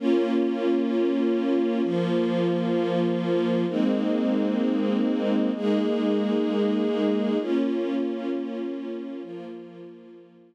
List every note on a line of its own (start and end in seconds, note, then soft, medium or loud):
0.00 1.82 A#3 medium
0.00 1.82 C#4 medium
0.00 1.82 F4 medium
1.83 3.65 F3 medium
1.83 3.65 A#3 medium
1.83 3.65 F4 medium
3.69 5.51 G#3 medium
3.69 5.51 A#3 medium
3.69 5.51 C4 medium
3.69 5.51 D#4 medium
5.55 7.38 G#3 medium
5.55 7.38 A#3 medium
5.55 7.38 D#4 medium
5.55 7.38 G#4 medium
7.40 9.22 A#3 medium
7.40 9.23 C#4 medium
7.40 9.22 F4 medium
9.22 10.55 F3 medium
9.22 10.55 A#3 medium
9.22 10.55 F4 medium